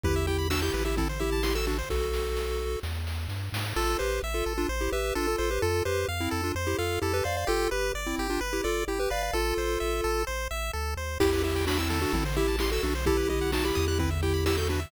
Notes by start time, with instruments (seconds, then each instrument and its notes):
0.03 synth bass 1 E2, lead 1 (square) E4 G4 B4, kick, floor tom
0.16 lead 1 (square) E5
0.27 lead 1 (square) E4 G4 G5, floor tom
0.39 lead 1 (square) B5
0.50 lead 1 (square) D4 F#4 E6, snare
0.62 lead 1 (square) E4 G4 G6
0.74 synth bass 1 A1, lead 1 (square) B4, floor tom
0.85 lead 1 (square) E4 G4 E5
0.97 lead 1 (square) C4 E4 A4, kick, floor tom
1.09 lead 1 (square) C5
1.20 lead 1 (square) E4 G4 E5, floor tom
1.32 lead 1 (square) A5
1.43 lead 1 (square) E4 G4 C6, snare
1.55 lead 1 (square) F#4 A4 E6
1.67 lead 1 (square) D4 F#4 A4, floor tom
1.78 lead 1 (square) C5
1.90 synth bass 1 B1, lead 1 (square) F#4 A4, kick, snare
2.13 snare
2.37 snare
2.83 synth bass 1 E2, snare
3.07 snare
3.29 synth bass 1 G2, snare
3.52 synth bass 1 G#2, snare
3.76 synth bass 1 A1, lead 1 (square) F4 A4
3.99 synth bass 1 A1, lead 1 (square) G4 B4 C5
4.23 synth bass 1 A1, lead 1 (square) E5
4.34 lead 1 (square) F4 A4
4.46 synth bass 1 A1, lead 1 (square) A4
4.58 lead 1 (square) D4 F4
4.69 synth bass 1 A1, lead 1 (square) C5
4.81 lead 1 (square) E4 G4
4.92 synth bass 1 A1, lead 1 (square) G4 B4 E5
5.15 synth bass 1 A1, lead 1 (square) D4 F4 A4
5.27 lead 1 (square) F4 A4
5.38 synth bass 1 A1, lead 1 (square) F4 A4 C5
5.51 lead 1 (square) G4 B4
5.62 synth bass 1 F2, lead 1 (square) F4 A4
5.85 synth bass 1 F2, lead 1 (square) G4 B4 C5
6.08 synth bass 1 F2, lead 1 (square) F5
6.20 lead 1 (square) C4 E4
6.31 synth bass 1 F2, lead 1 (square) A4
6.44 lead 1 (square) D4 F4
6.55 synth bass 1 F2, lead 1 (square) C5
6.67 lead 1 (square) E4 G4
6.78 synth bass 1 F2, lead 1 (square) F4 A4 F5
7.02 synth bass 1 F2, lead 1 (square) E4 G4 A4
7.13 lead 1 (square) G4 B4
7.24 synth bass 1 F2, lead 1 (square) C5 D5 F5
7.37 lead 1 (square) D5 F5
7.47 synth bass 1 G1, lead 1 (square) F4 G4 A4
7.71 synth bass 1 G1, lead 1 (square) G4 B4
7.94 synth bass 1 G1, lead 1 (square) D5
8.06 lead 1 (square) C4 E4
8.18 synth bass 1 G1, lead 1 (square) G4
8.30 lead 1 (square) D4 F4
8.41 synth bass 1 G1, lead 1 (square) B4
8.53 lead 1 (square) E4 G4
8.64 synth bass 1 G1, lead 1 (square) F4 A4 D5
8.87 synth bass 1 G1, lead 1 (square) E4 G4
9.00 lead 1 (square) G4 B4
9.10 synth bass 1 G1, lead 1 (square) B4 D5 F5
9.23 lead 1 (square) D5 F5
9.33 synth bass 1 A1, lead 1 (square) F4 A4
9.58 synth bass 1 A1, lead 1 (square) C5
9.80 synth bass 1 A1, lead 1 (square) E5
10.04 synth bass 1 A1, lead 1 (square) A4
10.27 synth bass 1 A1, lead 1 (square) C5
10.51 synth bass 1 A1, lead 1 (square) E5
10.73 synth bass 1 D2, lead 1 (square) A4
10.97 synth bass 1 D#2, lead 1 (square) C5
11.20 synth bass 1 E2, lead 1 (square) E4 G4, kick, crash
11.33 lead 1 (square) B4
11.44 lead 1 (square) E4 G4 E5, floor tom
11.55 lead 1 (square) G5
11.67 lead 1 (square) D4 F#4 B5, snare
11.78 lead 1 (square) C4 E4 E6
11.90 lead 1 (square) A4, floor tom
12.02 lead 1 (square) D4 F#4
12.13 synth bass 1 A1, lead 1 (square) C4 E4, kick, floor tom
12.25 lead 1 (square) C5
12.36 lead 1 (square) E4 G4 E5, floor tom
12.48 lead 1 (square) A5
12.59 lead 1 (square) E4 G4 C6, snare
12.71 lead 1 (square) F#4 A4 E6
12.83 synth bass 1 B1, lead 1 (square) D4 F#4 A4, floor tom
12.95 lead 1 (square) C5
13.06 lead 1 (square) E4 G4 A4, kick, floor tom
13.17 lead 1 (square) B4
13.29 lead 1 (square) E4 G4 D#5, floor tom
13.41 lead 1 (square) F#5
13.52 lead 1 (square) D#4 F#4 A5, snare
13.65 lead 1 (square) E4 G4 B5
13.75 synth bass 1 E2, lead 1 (square) D#6, floor tom
13.88 lead 1 (square) E4 G4 F#6
13.99 lead 1 (square) C4 E4 B4, kick, floor tom
14.11 lead 1 (square) E5
14.22 lead 1 (square) E4 G4 G5, floor tom
14.34 lead 1 (square) B5
14.46 lead 1 (square) E4 G4 E6, snare
14.57 lead 1 (square) F#4 A4 G6
14.69 lead 1 (square) D4 F#4 B4, floor tom
14.80 lead 1 (square) E5